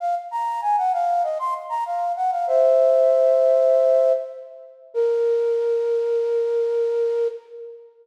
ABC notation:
X:1
M:4/4
L:1/16
Q:1/4=97
K:Bbm
V:1 name="Flute"
f z b2 a g f2 e c' z b f2 g f | [c=e]12 z4 | B16 |]